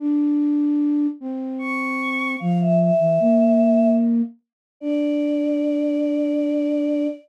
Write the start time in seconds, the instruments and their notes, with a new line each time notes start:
0.00 flute D4
1.21 flute C4
1.59 choir aahs C#6
2.39 flute F3, choir aahs F5
2.60 choir aahs E5
2.80 choir aahs E5
3.00 flute E3
3.20 flute A#3
4.81 flute D4, choir aahs D5